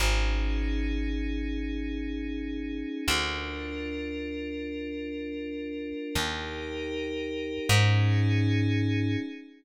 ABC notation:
X:1
M:6/8
L:1/8
Q:3/8=78
K:Ablyd
V:1 name="Pad 5 (bowed)"
[_DEA]6- | [_DEA]6 | [DFB]6- | [DFB]6 |
[EGB]6 | [_DEA]6 |]
V:2 name="Electric Bass (finger)" clef=bass
A,,,6- | A,,,6 | D,,6- | D,,6 |
E,,6 | A,,6 |]